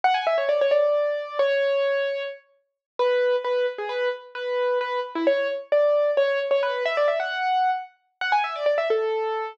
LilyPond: \new Staff { \time 6/8 \key fis \minor \tempo 4. = 88 fis''16 gis''16 e''16 cis''16 d''16 cis''16 d''4. | cis''2 r4 | r8 b'4 b'8 r16 gis'16 b'8 | r8 b'4 b'8 r16 e'16 cis''8 |
r8 d''4 cis''8 r16 cis''16 b'8 | e''16 d''16 e''16 fis''4~ fis''16 r4 | fis''16 gis''16 e''16 d''16 d''16 e''16 a'4. | }